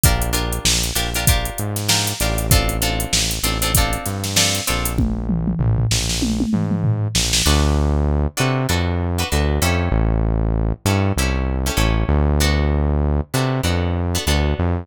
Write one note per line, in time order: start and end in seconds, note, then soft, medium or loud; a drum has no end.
0.03 0.59 A#1 medium
0.03 0.30 D4 medium
0.03 0.30 F4 loud
0.03 0.30 G4 medium
0.03 0.30 A#4 medium
0.03 kick loud
0.03 closed hi-hat loud
0.22 closed hi-hat medium
0.33 0.84 D4 medium
0.33 0.84 F4 medium
0.33 0.84 G4 medium
0.33 0.84 A#4 medium
0.33 closed hi-hat medium
0.52 closed hi-hat medium
0.65 0.92 A#1 medium
0.65 snare loud
0.83 closed hi-hat medium
0.95 1.50 A#1 medium
0.95 1.10 D4 medium
0.95 1.10 F4 medium
0.95 1.10 G4 medium
0.95 1.10 A#4 medium
0.95 closed hi-hat medium
1.14 1.25 D4 medium
1.14 1.25 F4 medium
1.14 1.25 G4 medium
1.14 1.25 A#4 medium
1.14 closed hi-hat medium
1.27 1.79 D4 medium
1.27 1.79 F4 medium
1.27 1.79 G4 medium
1.27 1.79 A#4 medium
1.27 kick medium
1.27 closed hi-hat loud
1.45 closed hi-hat medium
1.58 2.13 G#2 medium
1.58 closed hi-hat medium
1.76 snare medium
1.76 closed hi-hat medium
1.88 2.14 D4 medium
1.88 2.14 F4 medium
1.88 2.14 G4 medium
1.88 2.14 A#4 medium
1.88 snare loud
2.07 closed hi-hat medium
2.20 3.06 A1 medium
2.20 2.47 D4 medium
2.20 2.47 F4 medium
2.20 2.47 G4 medium
2.20 2.47 A#4 medium
2.20 snare soft
2.20 closed hi-hat medium
2.38 closed hi-hat medium
2.51 2.77 C4 loud
2.51 2.77 D4 medium
2.51 2.77 F4 loud
2.51 2.77 A4 medium
2.51 kick loud
2.51 closed hi-hat loud
2.69 closed hi-hat medium
2.82 3.33 C4 medium
2.82 3.33 D4 medium
2.82 3.33 F4 medium
2.82 3.33 A4 medium
2.82 closed hi-hat medium
3.00 closed hi-hat medium
3.12 3.39 A1 medium
3.12 snare loud
3.31 closed hi-hat medium
3.43 3.97 A1 medium
3.43 3.58 C4 medium
3.43 3.58 D4 medium
3.43 3.58 F4 medium
3.43 3.58 A4 medium
3.43 closed hi-hat medium
3.62 3.72 C4 medium
3.62 3.72 D4 medium
3.62 3.72 F4 medium
3.62 3.72 A4 medium
3.62 closed hi-hat medium
3.75 4.28 C4 medium
3.75 4.28 D4 medium
3.75 4.28 F4 medium
3.75 4.28 A4 medium
3.75 kick medium
3.75 closed hi-hat loud
3.93 closed hi-hat medium
4.06 4.60 G2 medium
4.06 snare soft
4.06 closed hi-hat medium
4.24 snare medium
4.24 closed hi-hat medium
4.36 4.62 C4 medium
4.36 4.62 D4 medium
4.36 4.62 F4 medium
4.36 4.62 A4 medium
4.36 snare loud
4.54 snare soft
4.54 closed hi-hat medium
4.67 5.54 A#1 medium
4.67 4.93 C4 medium
4.67 4.93 D4 medium
4.67 4.93 F4 medium
4.67 4.93 A4 medium
4.67 closed hi-hat medium
4.85 closed hi-hat medium
4.98 kick medium
4.98 high tom medium
5.29 mid tom medium
5.47 mid tom medium
5.59 5.86 A#1 medium
5.59 floor tom medium
5.78 floor tom medium
5.91 6.45 A#1 medium
5.91 snare medium
6.09 snare medium
6.22 high tom medium
6.40 high tom medium
6.53 7.08 G#2 medium
6.53 mid tom medium
6.71 mid tom medium
6.84 floor tom medium
7.15 7.42 A#1 medium
7.15 snare loud
7.33 snare loud
7.46 8.27 D2 loud
7.46 7.97 D4 medium
7.46 7.97 F#4 medium
7.46 7.97 A4 medium
7.46 7.97 B4 medium
8.37 8.67 C3 loud
8.37 8.63 D4 medium
8.37 8.63 F#4 medium
8.37 8.63 A4 medium
8.37 8.63 B4 medium
8.69 9.24 F2 medium
8.69 9.07 D4 medium
8.69 9.07 F#4 medium
8.69 9.07 A4 medium
8.69 9.07 B4 medium
9.18 9.29 D4 medium
9.18 9.29 F#4 medium
9.18 9.29 A4 medium
9.18 9.29 B4 medium
9.32 9.59 D2 loud
9.32 9.61 D4 medium
9.32 9.61 F#4 medium
9.32 9.61 A4 medium
9.32 9.61 B4 medium
9.62 9.89 F2 loud
9.62 10.44 C#4 medium
9.62 10.44 E4 loud
9.62 10.44 G4 medium
9.62 10.44 A4 medium
9.92 10.73 A1 loud
10.85 11.12 G2 loud
10.85 11.11 C#4 medium
10.85 11.11 E4 medium
10.85 11.11 G4 medium
10.85 11.11 A4 medium
11.16 11.70 C2 medium
11.16 11.56 C#4 medium
11.16 11.56 E4 medium
11.16 11.56 G4 medium
11.16 11.56 A4 medium
11.66 11.76 C#4 medium
11.66 11.76 E4 medium
11.66 11.76 G4 medium
11.66 11.76 A4 medium
11.77 12.04 A1 loud
11.77 12.28 C#4 medium
11.77 12.28 E4 medium
11.77 12.28 G4 medium
11.77 12.28 A4 medium
12.09 13.21 D2 loud
12.40 12.92 B3 medium
12.40 12.92 D4 medium
12.40 12.92 F#4 medium
12.40 12.92 A4 medium
13.34 13.61 C3 loud
13.34 13.59 B3 medium
13.34 13.59 D4 medium
13.34 13.59 F#4 medium
13.34 13.59 A4 medium
13.63 14.18 F2 medium
13.63 14.02 B3 medium
13.63 14.02 D4 medium
13.63 14.02 F#4 medium
13.63 14.02 A4 medium
14.15 14.25 B3 medium
14.15 14.25 D4 medium
14.15 14.25 F#4 medium
14.15 14.25 A4 medium
14.27 14.54 D2 loud
14.27 14.78 B3 medium
14.27 14.78 D4 medium
14.27 14.78 F#4 medium
14.27 14.78 A4 medium
14.59 14.86 F2 loud